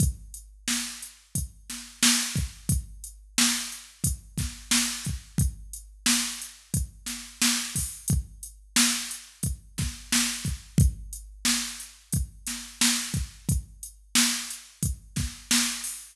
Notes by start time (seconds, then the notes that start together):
0.00 kick, closed hi-hat
0.34 closed hi-hat
0.68 snare
1.02 closed hi-hat
1.35 kick, closed hi-hat
1.70 snare, closed hi-hat
2.03 snare
2.36 kick, closed hi-hat
2.69 kick, closed hi-hat
3.04 closed hi-hat
3.38 snare
3.72 closed hi-hat
4.04 kick, closed hi-hat
4.38 kick, snare, closed hi-hat
4.71 snare
5.05 kick, closed hi-hat
5.38 kick, closed hi-hat
5.73 closed hi-hat
6.06 snare
6.42 closed hi-hat
6.74 kick, closed hi-hat
7.06 snare, closed hi-hat
7.42 snare
7.75 kick, open hi-hat
8.08 kick, closed hi-hat
8.43 closed hi-hat
8.76 snare
9.11 closed hi-hat
9.43 kick, closed hi-hat
9.78 kick, snare, closed hi-hat
10.12 snare
10.45 kick, closed hi-hat
10.78 kick, closed hi-hat
11.13 closed hi-hat
11.45 snare
11.80 closed hi-hat
12.12 kick, closed hi-hat
12.47 snare, closed hi-hat
12.81 snare
13.14 kick, closed hi-hat
13.49 kick, closed hi-hat
13.83 closed hi-hat
14.15 snare
14.50 closed hi-hat
14.83 kick, closed hi-hat
15.16 kick, snare, closed hi-hat
15.51 snare
15.84 open hi-hat